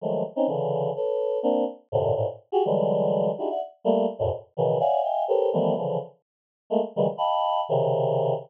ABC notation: X:1
M:7/8
L:1/16
Q:1/4=125
K:none
V:1 name="Choir Aahs"
[^D,F,^F,^G,A,]2 z [C^C^D] [^C,=D,E,]4 [AB^c]4 [^A,=C=D]2 | z2 [^F,,^G,,A,,^A,,C,D,]2 [G,,=A,,^A,,] z2 [^F=G^G] [D,E,^F,=G,^G,]6 | [D^DE^FG^G] [=de^f] z2 [=G,A,^A,]2 z [E,,=F,,^F,,^G,,=A,,B,,] z2 [B,,^C,^D,E,]2 [^c=de=f^f^g]2 | [^defg^g]2 [=GA^ABc^c]2 [^D,E,F,G,=A,B,]2 [^C,=D,E,F,]2 z6 |
[^G,A,^A,] z [^C,^D,E,^F,=G,^G,] z [^d=f=g=ab]4 [=C,^C,D,]6 |]